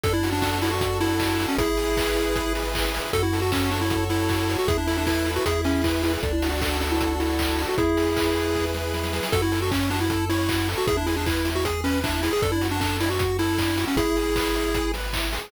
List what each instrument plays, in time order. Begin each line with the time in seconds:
0.03 synth bass 1 F#2, lead 1 (square) D4 A4, kick, closed hi-hat
0.13 lead 1 (square) E4
0.23 lead 1 (square) F#4, open hi-hat
0.33 lead 1 (square) D4
0.42 lead 1 (square) D4 A4, kick, clap
0.62 lead 1 (square) D4 E4, open hi-hat
0.71 lead 1 (square) F#4
0.81 lead 1 (square) F#4, kick, closed hi-hat
1.00 lead 1 (square) E4 A4, open hi-hat
1.20 lead 1 (square) D4, kick, clap
1.39 lead 1 (square) F#4, open hi-hat
1.49 lead 1 (square) C#4
1.58 synth bass 1 G#1, lead 1 (square) E4 G#4, kick, closed hi-hat
1.77 lead 1 (square) G#4, open hi-hat
1.97 lead 1 (square) B4, kick, clap
2.17 lead 1 (square) E4, open hi-hat
2.35 lead 1 (square) G#4, kick, closed hi-hat
2.55 lead 1 (square) B4, open hi-hat
2.75 lead 1 (square) E4, kick, clap
2.94 lead 1 (square) G#4, open hi-hat
3.13 synth bass 1 F#2, lead 1 (square) F#4 A4, kick, closed hi-hat
3.23 lead 1 (square) E4
3.33 lead 1 (square) A4, open hi-hat
3.42 lead 1 (square) F#4
3.52 lead 1 (square) C#4 C#5, kick, clap
3.71 lead 1 (square) D4 F#4, open hi-hat
3.81 lead 1 (square) E4
3.90 lead 1 (square) A4, kick, closed hi-hat
4.10 lead 1 (square) E4 C#5, open hi-hat
4.29 lead 1 (square) F#4, kick, clap
4.49 lead 1 (square) A4, open hi-hat
4.59 lead 1 (square) F#4
4.68 synth bass 1 E2, lead 1 (square) E4 G#4, kick, closed hi-hat
4.78 lead 1 (square) D4
4.87 lead 1 (square) E4 A4, open hi-hat
4.97 lead 1 (square) D4
5.07 lead 1 (square) E4 B4, kick, clap
5.26 lead 1 (square) E4, open hi-hat
5.36 lead 1 (square) F#4
5.45 synth bass 1 E2, lead 1 (square) E4 G#4, kick, closed hi-hat
5.64 lead 1 (square) C#4 G#4, open hi-hat
5.84 lead 1 (square) E4 B4, kick, clap
6.03 lead 1 (square) E4, open hi-hat
6.13 lead 1 (square) G#4
6.23 synth bass 1 D2, lead 1 (square) D4 A4, kick, closed hi-hat
6.33 lead 1 (square) E4
6.42 lead 1 (square) F#4, open hi-hat
6.52 lead 1 (square) F#4
6.61 lead 1 (square) D4 A4, kick, clap
6.81 lead 1 (square) D4, open hi-hat
6.91 lead 1 (square) E4
7.00 lead 1 (square) F#4, kick, closed hi-hat
7.20 lead 1 (square) E4 A4, open hi-hat
7.39 lead 1 (square) D4, kick, clap
7.58 lead 1 (square) F#4, open hi-hat
7.68 lead 1 (square) F#4
7.78 synth bass 1 E2, lead 1 (square) E4 G#4, kick, closed hi-hat
7.97 lead 1 (square) G#4, open hi-hat
8.16 lead 1 (square) B4, kick, clap
8.36 lead 1 (square) E4, open hi-hat
8.55 lead 1 (square) G#4, kick, snare
8.74 lead 1 (square) B4, snare
8.94 lead 1 (square) E4, snare
9.03 snare
9.13 lead 1 (square) G#4, snare
9.23 snare
9.32 synth bass 1 F#2, lead 1 (square) F#4 A4, kick, closed hi-hat
9.42 lead 1 (square) E4
9.52 lead 1 (square) A4, open hi-hat
9.62 lead 1 (square) F#4
9.71 lead 1 (square) C#4 C#5, kick, clap
9.90 lead 1 (square) D4 F#4, open hi-hat
10.00 lead 1 (square) E4
10.10 lead 1 (square) A4, kick, closed hi-hat
10.29 lead 1 (square) E4 C#5, open hi-hat
10.49 lead 1 (square) F#4, kick, clap
10.68 lead 1 (square) A4, open hi-hat
10.78 lead 1 (square) F#4
10.87 synth bass 1 E2, lead 1 (square) E4 G#4, kick, closed hi-hat
10.97 lead 1 (square) D4
11.06 lead 1 (square) E4 G#4, open hi-hat
11.16 lead 1 (square) D4
11.26 lead 1 (square) E4 B4, kick, clap
11.45 lead 1 (square) E4, open hi-hat
11.55 lead 1 (square) F#4
11.65 lead 1 (square) G#4, kick, closed hi-hat
11.84 lead 1 (square) C#4 B4, open hi-hat
12.03 lead 1 (square) D4 E4, kick, clap
12.23 lead 1 (square) E4 G#4, open hi-hat
12.33 lead 1 (square) G#4
12.42 synth bass 1 F#2, lead 1 (square) D4 A4, kick, closed hi-hat
12.52 lead 1 (square) E4
12.61 lead 1 (square) F#4, open hi-hat
12.71 lead 1 (square) D4
12.81 lead 1 (square) D4 A4, kick, clap
13.00 lead 1 (square) D4 E4, open hi-hat
13.10 lead 1 (square) F#4
13.19 lead 1 (square) F#4, kick, closed hi-hat
13.39 lead 1 (square) E4 A4, open hi-hat
13.58 lead 1 (square) D4, kick, clap
13.78 lead 1 (square) F#4, open hi-hat
13.87 lead 1 (square) C#4
13.96 synth bass 1 G#1, lead 1 (square) E4 G#4, kick, closed hi-hat
14.16 lead 1 (square) G#4, open hi-hat
14.36 lead 1 (square) B4, kick, clap
14.55 lead 1 (square) E4, open hi-hat
14.74 lead 1 (square) G#4, kick, closed hi-hat
14.94 lead 1 (square) B4, open hi-hat
15.13 lead 1 (square) E4, kick, clap
15.33 lead 1 (square) G#4, open hi-hat